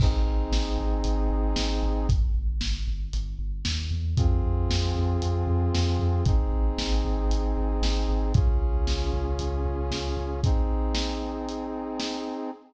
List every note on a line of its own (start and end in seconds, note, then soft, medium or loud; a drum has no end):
0.00 0.22 G#1 medium
0.00 2.07 C4 medium
0.00 2.07 D#4 loud
0.00 2.07 G#4 medium
0.00 kick loud
0.00 crash loud
0.26 0.48 G#1 medium
0.52 0.74 G#1 medium
0.52 snare loud
0.78 1.01 G#1 medium
1.04 1.27 G#1 medium
1.04 closed hi-hat medium
1.30 1.52 G#1 medium
1.56 1.78 G#1 medium
1.56 snare loud
1.83 2.05 G#1 medium
2.09 2.31 G1 loud
2.09 kick medium
2.09 closed hi-hat medium
2.34 2.57 G1 medium
2.61 2.83 G1 medium
2.61 snare loud
2.87 3.10 G1 medium
3.13 3.36 G1 medium
3.13 closed hi-hat medium
3.39 3.61 G1 medium
3.65 3.89 D#2 medium
3.65 snare loud
3.91 4.14 E2 medium
4.17 4.39 F2 medium
4.17 6.24 C4 medium
4.17 6.24 F4 loud
4.17 6.24 G#4 medium
4.17 kick loud
4.17 closed hi-hat medium
4.44 4.66 F2 medium
4.70 4.92 F2 medium
4.70 snare loud
4.95 5.17 F2 medium
5.22 5.44 F2 medium
5.22 closed hi-hat medium
5.47 5.69 F2 medium
5.75 5.97 F2 medium
5.75 snare loud
5.99 6.22 F2 medium
6.25 6.48 G#1 medium
6.25 8.32 C4 medium
6.25 8.32 D#4 medium
6.25 8.32 G#4 loud
6.25 kick loud
6.25 closed hi-hat medium
6.51 6.73 G#1 medium
6.78 7.01 G#1 medium
6.78 snare loud
7.05 7.27 G#1 medium
7.30 7.52 G#1 medium
7.30 closed hi-hat medium
7.57 7.79 G#1 medium
7.82 8.04 G#1 medium
7.82 snare loud
8.09 8.31 G#1 medium
8.34 8.57 C#2 loud
8.34 10.41 C#4 loud
8.34 10.41 F4 medium
8.34 10.41 G#4 loud
8.34 kick loud
8.34 closed hi-hat medium
8.61 8.83 C#2 medium
8.87 9.09 C#2 medium
8.87 snare loud
9.14 9.36 C#2 medium
9.39 9.62 C#2 medium
9.39 closed hi-hat medium
9.65 9.87 C#2 medium
9.91 10.13 C#2 medium
9.91 snare medium
10.17 10.39 C#2 medium
10.44 12.50 C4 loud
10.44 12.50 D#4 medium
10.44 12.50 G#4 medium
10.44 kick medium
10.44 closed hi-hat medium
10.95 snare loud
11.49 closed hi-hat medium
12.00 snare loud